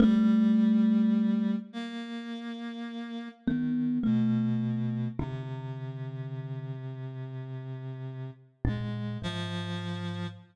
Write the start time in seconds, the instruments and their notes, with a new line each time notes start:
0.00 clarinet G3, kalimba A3
1.73 clarinet A#3
3.46 clarinet D#3, kalimba B3
4.03 clarinet B2, kalimba A3
5.19 clarinet C3, kalimba D3
8.65 kalimba A#2, clarinet G#3
9.22 kalimba G#2, clarinet F3